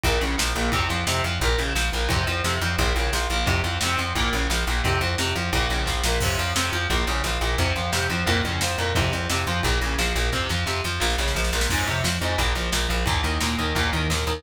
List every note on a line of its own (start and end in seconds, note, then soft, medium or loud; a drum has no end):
0.03 0.19 A#1 loud
0.03 0.21 A#2 medium
0.03 kick medium
0.03 ride loud
0.21 0.36 A#1 medium
0.21 0.36 C#3 medium
0.21 ride medium
0.38 0.53 A#1 medium
0.38 0.53 F3 medium
0.38 snare loud
0.55 0.70 A#1 loud
0.55 0.71 A#2 medium
0.55 ride medium
0.72 0.87 F2 loud
0.72 0.88 C3 medium
0.72 kick loud
0.72 ride loud
0.89 1.04 F2 medium
0.89 1.05 F3 medium
0.89 ride medium
1.07 1.21 F2 medium
1.07 1.22 C3 medium
1.07 snare loud
1.24 1.39 F2 medium
1.24 1.40 F3 medium
1.24 ride medium
1.40 1.56 A#1 loud
1.40 1.58 A#2 medium
1.40 kick medium
1.40 ride medium
1.58 1.73 A#1 medium
1.58 1.74 C#3 medium
1.58 ride medium
1.75 1.90 A#1 medium
1.75 1.91 F3 medium
1.75 snare loud
1.92 2.08 A#1 medium
1.92 2.10 A#2 medium
1.92 ride medium
2.09 2.25 F2 loud
2.09 2.26 C3 medium
2.09 kick loud
2.09 ride loud
2.27 2.42 F2 loud
2.27 2.42 F3 medium
2.27 ride medium
2.44 2.59 F2 medium
2.44 2.60 C3 medium
2.44 snare loud
2.61 2.76 F2 loud
2.61 2.78 F3 medium
2.61 ride medium
2.78 2.93 A#1 loud
2.78 2.94 A#2 medium
2.78 kick medium
2.78 ride loud
2.95 3.10 A#1 loud
2.95 3.12 C#3 medium
2.95 ride medium
3.13 3.27 A#1 medium
3.13 3.29 F3 medium
3.13 snare loud
3.30 3.44 A#1 medium
3.30 3.46 A#2 medium
3.30 ride medium
3.46 3.62 F2 loud
3.46 3.61 C3 medium
3.46 kick loud
3.46 ride loud
3.64 3.78 F2 medium
3.64 3.79 F3 medium
3.64 ride medium
3.81 3.96 F2 medium
3.81 3.98 C3 medium
3.81 snare loud
3.97 4.13 F2 medium
3.97 4.13 F3 medium
3.97 ride medium
4.15 4.30 A#1 medium
4.15 4.32 A#2 medium
4.15 kick medium
4.15 ride medium
4.33 4.47 A#1 loud
4.33 4.49 C#3 medium
4.33 ride medium
4.50 4.64 A#1 medium
4.50 4.65 F3 medium
4.50 snare loud
4.67 4.82 A#1 loud
4.67 4.83 A#2 medium
4.67 ride medium
4.84 4.99 F2 loud
4.84 4.99 C3 medium
4.84 kick loud
4.84 ride loud
5.01 5.15 F2 loud
5.01 5.16 F3 medium
5.01 ride medium
5.18 5.33 F2 loud
5.18 5.34 C3 medium
5.18 snare loud
5.35 5.50 F2 medium
5.35 5.51 F3 medium
5.35 ride medium
5.53 5.67 A#1 loud
5.53 5.70 A#2 medium
5.53 kick medium
5.53 ride loud
5.69 5.85 A#1 medium
5.69 5.86 C#3 medium
5.69 ride medium
5.86 6.02 A#1 medium
5.86 6.01 F3 medium
5.86 kick medium
5.86 snare medium
6.04 6.19 A#1 loud
6.04 6.20 A#2 medium
6.04 snare loud
6.20 6.36 F2 loud
6.20 6.38 C3 medium
6.20 kick loud
6.20 crash loud
6.38 6.53 F2 loud
6.38 6.53 F3 medium
6.38 ride medium
6.55 6.70 F2 medium
6.55 6.71 C3 medium
6.55 snare loud
6.72 6.87 F2 medium
6.72 6.88 F3 medium
6.72 ride medium
6.90 7.05 A#1 loud
6.90 7.05 A#2 medium
6.90 kick medium
6.90 ride medium
7.07 7.22 A#1 loud
7.07 7.23 C#3 medium
7.07 ride medium
7.24 7.38 A#1 medium
7.24 7.41 F3 medium
7.24 snare medium
7.41 7.56 A#1 medium
7.41 7.57 A#2 medium
7.41 ride medium
7.58 7.73 F2 loud
7.58 7.74 C3 medium
7.58 kick medium
7.58 ride medium
7.76 7.90 F2 medium
7.76 7.91 F3 medium
7.76 ride medium
7.92 8.08 F2 loud
7.92 8.08 C3 medium
7.92 snare loud
8.10 8.24 F2 medium
8.10 8.25 F3 medium
8.10 ride medium
8.26 8.42 F2 loud
8.26 8.42 A#2 medium
8.26 kick medium
8.26 ride loud
8.43 8.59 F2 medium
8.43 8.60 C#3 medium
8.43 ride medium
8.61 8.76 F2 medium
8.61 8.77 F3 medium
8.61 snare loud
8.78 8.93 F2 medium
8.78 8.93 A#2 medium
8.78 ride medium
8.95 9.10 F2 loud
8.95 9.11 C3 medium
8.95 kick loud
8.95 ride loud
9.12 9.27 F2 medium
9.12 9.27 F3 medium
9.12 ride medium
9.30 9.45 F2 medium
9.30 9.45 C3 medium
9.30 snare loud
9.47 9.61 F2 medium
9.47 9.63 F3 medium
9.47 ride medium
9.63 9.79 A#1 loud
9.63 9.80 A#2 medium
9.63 kick medium
9.63 ride loud
9.81 9.96 A#1 medium
9.81 9.98 C#3 medium
9.81 ride medium
9.98 10.13 A#1 loud
9.98 10.14 F3 medium
9.98 snare loud
10.15 10.30 A#1 loud
10.15 10.31 A#2 medium
10.15 ride medium
10.32 10.47 F2 medium
10.32 10.48 C3 medium
10.32 kick medium
10.32 snare medium
10.49 10.65 F2 medium
10.49 10.65 F3 medium
10.49 snare medium
10.66 10.81 F2 medium
10.66 10.81 C3 medium
10.66 snare medium
10.84 10.99 F2 medium
10.84 11.00 F3 medium
10.84 snare medium
11.00 11.16 A#1 loud
11.00 11.15 A#2 medium
11.00 snare medium
11.10 snare medium
11.18 11.33 A#1 loud
11.18 11.34 C#3 medium
11.18 snare medium
11.28 snare medium
11.35 11.51 A#1 medium
11.35 11.50 F3 medium
11.35 snare medium
11.44 snare medium
11.53 11.67 A#1 loud
11.53 11.68 A#2 medium
11.53 snare medium
11.61 snare loud
11.69 11.85 F2 loud
11.69 11.86 G#2 medium
11.69 kick medium
11.69 crash medium
11.86 12.02 F2 medium
11.86 12.03 C3 medium
11.86 ride medium
12.04 12.19 F2 medium
12.04 12.19 F3 medium
12.04 snare loud
12.21 12.36 F2 loud
12.21 12.38 G#2 medium
12.21 ride medium
12.38 12.53 A#1 loud
12.38 12.54 A#2 medium
12.38 kick medium
12.38 ride medium
12.55 12.70 A#1 medium
12.55 12.71 F3 medium
12.55 ride medium
12.72 12.87 A#1 medium
12.72 12.87 A#2 medium
12.72 snare loud
12.89 13.04 A#1 medium
12.89 13.04 F3 medium
12.89 ride medium
13.06 13.22 D#2 loud
13.06 13.22 A#2 medium
13.06 kick loud
13.06 ride loud
13.23 13.39 D#2 medium
13.23 13.38 D#3 medium
13.23 ride medium
13.40 13.56 D#2 medium
13.40 13.57 A#2 medium
13.40 snare loud
13.58 13.73 D#2 medium
13.58 13.74 D#3 medium
13.58 ride medium
13.75 13.90 D#2 loud
13.75 13.90 A#2 medium
13.75 kick medium
13.75 ride loud
13.93 14.08 D#2 medium
13.93 14.08 D#3 medium
13.93 ride medium
14.10 14.24 D#2 medium
14.10 14.25 A#2 medium
14.10 snare loud
14.27 14.41 D#2 loud
14.27 14.43 D#3 medium
14.27 ride medium